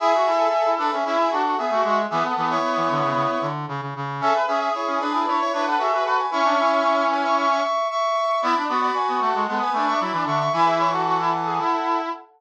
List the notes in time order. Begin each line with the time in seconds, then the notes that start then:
0.00 E4 G#4 E5
0.14 F#4
0.26 E4 A4
0.66 E4
0.78 D4 B4
0.92 C#4 G#4 E5
1.04 C#4 E4 G#4 E5
1.19 G#4 E5
1.30 D4 F#4 A4 F#5
1.44 F#4
1.57 B3 G#4 E5
1.71 A3 F#4
1.84 G#3 F#4
2.10 E3 B3 G#4 E5
2.24 A4 F#5
2.35 E3 B3
2.50 E4 C#5
2.62 B3
2.76 E3
2.90 D3
3.03 C#3
3.15 C#3
3.41 D3
3.68 C#3
3.81 C#3
3.96 C#3
4.21 C#4 G#4 A4 E5
4.34 B4
4.47 C#4 G#4 E5
4.60 G#4 E5
4.74 E4 C#5
4.87 C#4
5.00 D4 B4
5.14 E4
5.26 D4 E4 B4 C#5
5.40 E4 C#5
5.53 D4 E4 B4 C#5
5.67 A4 B4 F#5
5.79 F#4 G#4 A4 E5
5.92 F#4 B4
6.04 F#4 A4 B4 F#5
6.18 B4 G#5
6.31 C#4 E4 E5 C#6
6.45 D4
6.59 E4
7.10 B4 G#5
7.23 E5 C#6
7.37 E5 C#6
7.51 E5 C#6
7.63 E5 C#6
7.90 E5 C#6
8.42 B3 E4 D5 B5
8.56 D4
8.68 B3 F#4 D5 B5
8.82 D5 B5
8.94 B4 G#5
9.08 B3
9.20 A3 A4 F#5
9.35 G#3
9.47 G#3 B3 A4 F#5
9.61 B4 G#5
9.73 A3 D4 B4 G#5
9.87 D4 E5 C#6
10.00 F#3 E4 D5 B5
10.12 E3 D4
10.25 D3 D4 E5 C#6
10.40 E5 C#6
10.53 E3 E4 B4 G#5
10.66 G#4 E5
10.79 E4 C#5
10.91 F#4 A4 F#5
11.05 F#4
11.18 E4
11.45 G#4
11.58 E4